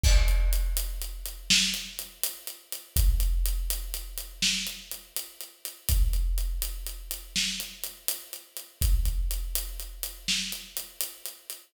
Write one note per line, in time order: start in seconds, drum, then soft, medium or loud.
0.04 kick loud
0.04 crash loud
0.28 closed hi-hat medium
0.53 closed hi-hat medium
0.77 closed hi-hat loud
1.02 closed hi-hat medium
1.26 closed hi-hat medium
1.50 snare loud
1.74 closed hi-hat medium
1.99 closed hi-hat medium
2.23 closed hi-hat loud
2.47 closed hi-hat medium
2.72 closed hi-hat medium
2.96 kick loud
2.96 closed hi-hat loud
3.20 closed hi-hat medium
3.46 closed hi-hat loud
3.70 closed hi-hat loud
3.94 closed hi-hat medium
4.18 closed hi-hat medium
4.42 snare loud
4.67 closed hi-hat medium
4.91 closed hi-hat medium
5.17 closed hi-hat loud
5.41 closed hi-hat medium
5.65 closed hi-hat medium
5.89 kick loud
5.89 closed hi-hat loud
6.13 closed hi-hat medium
6.38 closed hi-hat medium
6.62 closed hi-hat loud
6.87 closed hi-hat medium
7.11 closed hi-hat loud
7.36 snare loud
7.60 closed hi-hat medium
7.84 closed hi-hat medium
8.08 closed hi-hat loud
8.33 closed hi-hat medium
8.57 closed hi-hat medium
8.81 kick loud
8.81 closed hi-hat loud
9.05 kick medium
9.05 closed hi-hat medium
9.31 closed hi-hat medium
9.55 closed hi-hat loud
9.80 closed hi-hat medium
10.03 closed hi-hat loud
10.28 snare loud
10.52 closed hi-hat medium
10.77 closed hi-hat loud
11.01 closed hi-hat loud
11.26 closed hi-hat medium
11.50 closed hi-hat medium